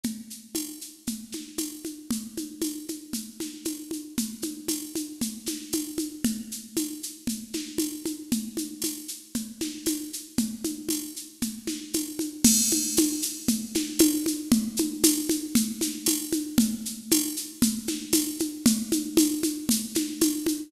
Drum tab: CC |--------|--------|--------|--------|
TB |--x---x-|--x---x-|--x---x-|--x---x-|
SH |xxxxxxxx|xxxxxxxx|xxxxxxxx|xxxxxxxx|
SD |-----o--|-----o--|-----o--|-----o--|
CG |O-o-Oooo|OoooOooo|OoooOooo|O-o-Oooo|

CC |--------|--------|x-------|--------|
TB |--x---x-|--x---x-|--x---x-|--x---x-|
SH |xxxxxxxx|xxxxxxxx|xxxxxxxx|xxxxxxxx|
SD |-----o--|-----o--|-----o--|-----o--|
CG |Ooo-Ooo-|Ooo-Oooo|Ooo-Oooo|OoooOooo|

CC |--------|--------|
TB |--x---x-|--x---x-|
SH |xxxxxxxx|xxxxxxxx|
SD |-----o--|-----o--|
CG |O-o-Oooo|OoooOooo|